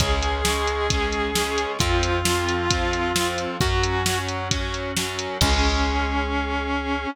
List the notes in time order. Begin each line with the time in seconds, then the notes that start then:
0.00 C#2 G#3 C#4 G#4, kick, closed hi-hat
0.23 closed hi-hat
0.45 G#3 C#4, snare
0.67 closed hi-hat
0.90 G#3 C#4, kick, closed hi-hat
1.13 closed hi-hat
1.35 G#3 C#4, snare
1.58 closed hi-hat
1.79 F2 F3 C4 F4, kick, closed hi-hat
2.03 closed hi-hat
2.25 F3 C4, snare
2.49 closed hi-hat
2.70 F3 C4, kick, closed hi-hat
2.93 closed hi-hat
3.16 F3 C4, snare
3.38 closed hi-hat
3.61 F#2 F#3 C#4 F#4, kick, closed hi-hat
3.83 closed hi-hat
4.06 F#3 C#4, snare
4.28 closed hi-hat
4.51 F#3 C#4, kick, closed hi-hat
4.74 closed hi-hat
4.97 F#3 C#4, snare
5.19 closed hi-hat
5.41 C#2 G#3 C#4 G#4, kick, crash